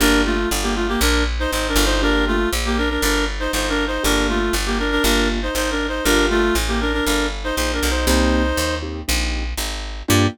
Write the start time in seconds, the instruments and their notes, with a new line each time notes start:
0.00 electric bass (finger) G1, acoustic grand piano A#3 D4 F4 G4, clarinet D4 A#4
0.25 clarinet A3 F4
0.51 electric bass (finger) G1
0.63 clarinet A#3 G4
0.75 clarinet A3 F4
0.88 clarinet A#3 G4
1.01 electric bass (finger) A#1, clarinet D4 A#4
1.39 clarinet D#4 C5
1.51 electric bass (finger) G#1, clarinet D#4 C5
1.68 clarinet D4 A#4
1.76 electric bass (finger) G1
1.85 clarinet D#4 C5
2.02 acoustic grand piano A#3 D4 F4 G4, clarinet D4 A#4
2.27 clarinet A3 F4
2.53 electric bass (finger) A#1
2.65 clarinet A#3 G4
2.78 clarinet D4 A#4
2.90 clarinet D4 A#4
3.02 electric bass (finger) G1, clarinet D4 A#4
3.40 clarinet D#4 C5
3.53 electric bass (finger) G1, clarinet D#4 C5
3.69 clarinet D4 A#4
3.87 clarinet D#4 C5
4.03 electric bass (finger) G1, acoustic grand piano A#3 D4 F4 G4, clarinet D4 A#4
4.29 clarinet A3 F4
4.53 electric bass (finger) G1
4.66 clarinet A#3 G4
4.79 clarinet D4 A#4
4.91 clarinet D4 A#4
5.04 electric bass (finger) G1, acoustic grand piano A#3 D4 F4 G4, clarinet D4 A#4
5.42 clarinet D#4 C5
5.55 electric bass (finger) G#1, clarinet D#4 C5
5.71 clarinet D4 A#4
5.88 clarinet D#4 C5
6.04 electric bass (finger) G1, acoustic grand piano A#3 D4 F4 G4, clarinet D4 A#4
6.30 clarinet A3 F4
6.55 electric bass (finger) A1
6.68 clarinet A#3 G4
6.81 clarinet D4 A#4
6.93 clarinet D4 A#4
7.05 electric bass (finger) G1, clarinet D4 A#4
7.44 clarinet D#4 C5
7.56 electric bass (finger) A#1, clarinet D#4 C5
7.73 clarinet D4 A#4
7.83 electric bass (finger) B1
7.90 clarinet D#4 C5
8.07 electric bass (finger) C2, acoustic grand piano A#3 C4 D#4 G4, clarinet D#4 C5
8.57 electric bass (finger) D#2
8.82 acoustic grand piano A#3 C4 D#4 G4
9.08 electric bass (finger) A#1, acoustic grand piano A#3 C4 D#4 G4
9.57 electric bass (finger) G#1
10.08 electric bass (finger) G2, acoustic grand piano A#3 D4 F4 G4, clarinet G4